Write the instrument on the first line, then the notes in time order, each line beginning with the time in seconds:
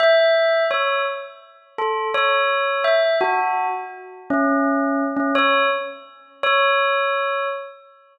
tubular bells
0.00 E5
0.71 C#5
1.78 A4
2.14 C#5
2.84 E5
3.21 F#4
4.30 C#4
5.17 C#4
5.35 C#5
6.43 C#5